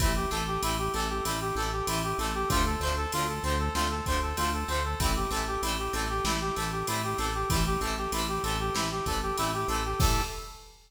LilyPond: <<
  \new Staff \with { instrumentName = "Brass Section" } { \time 4/4 \key a \minor \tempo 4 = 96 e'16 g'16 a'16 g'16 e'16 g'16 a'16 g'16 e'16 g'16 a'16 g'16 e'16 g'16 a'16 g'16 | f'16 a'16 c''16 a'16 f'16 a'16 c''16 a'16 f'16 a'16 c''16 a'16 f'16 a'16 c''16 a'16 | e'16 g'16 a'16 g'16 e'16 g'16 a'16 g'16 e'16 g'16 a'16 g'16 e'16 g'16 a'16 g'16 | e'16 g'16 a'16 g'16 e'16 g'16 a'16 g'16 e'16 g'16 a'16 g'16 e'16 g'16 a'16 g'16 |
a'4 r2. | }
  \new Staff \with { instrumentName = "Acoustic Guitar (steel)" } { \time 4/4 \key a \minor <e g a c'>8 <e g a c'>8 <e g a c'>8 <e g a c'>8 <e g a c'>8 <e g a c'>8 <e g a c'>8 <e g a c'>8 | <d f a c'>8 <d f a c'>8 <d f a c'>8 <d f a c'>8 <d f a c'>8 <d f a c'>8 <d f a c'>8 <d f a c'>8 | <e g a c'>8 <e g a c'>8 <e g a c'>8 <e g a c'>8 <e g a c'>8 <e g a c'>8 <e g a c'>8 <e g a c'>8 | <e g a c'>8 <e g a c'>8 <e g a c'>8 <e g a c'>8 <e g a c'>8 <e g a c'>8 <e g a c'>8 <e g a c'>8 |
<e g a c'>4 r2. | }
  \new Staff \with { instrumentName = "Synth Bass 1" } { \clef bass \time 4/4 \key a \minor a,,8 a,,8 a,,8 a,,8 a,,8 a,,8 a,,8 a,,8 | d,8 d,8 d,8 d,8 d,8 d,8 d,8 d,8 | a,,8 a,,8 a,,8 a,,8 a,,8 a,,8 a,,8 a,,8 | a,,8 a,,8 a,,8 a,,8 a,,8 a,,8 a,,8 a,,8 |
a,4 r2. | }
  \new DrumStaff \with { instrumentName = "Drums" } \drummode { \time 4/4 <bd cymr>8 cymr8 cymr8 cymr8 cymr4 cymr8 cymr8 | <bd cymr>8 cymr8 cymr8 cymr8 sn8 <bd cymr>8 cymr8 cymr8 | <bd cymr>8 cymr8 cymr8 cymr8 sn8 cymr8 cymr8 cymr8 | <bd cymr>8 cymr8 cymr8 cymr8 sn8 <bd cymr>8 cymr8 cymr8 |
<cymc bd>4 r4 r4 r4 | }
>>